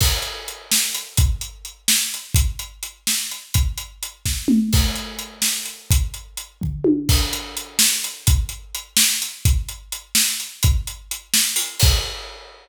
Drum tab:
CC |x----|-----|-----|-----|
HH |-xx-x|xxx-x|xxx-x|xxx--|
SD |---o-|---o-|---o-|---o-|
T1 |-----|-----|-----|-----|
T2 |-----|-----|-----|----o|
FT |-----|-----|-----|-----|
BD |o----|o----|o----|o--o-|

CC |x----|-----|x----|-----|
HH |-xx-x|xxx--|-xx-x|xxx-x|
SD |---o-|-----|---o-|---o-|
T1 |-----|----o|-----|-----|
T2 |-----|-----|-----|-----|
FT |-----|---o-|-----|-----|
BD |o----|o--o-|o----|o----|

CC |-----|-----|x----|
HH |xxx-x|xxx-o|-----|
SD |---o-|---o-|-----|
T1 |-----|-----|-----|
T2 |-----|-----|-----|
FT |-----|-----|-----|
BD |o----|o----|o----|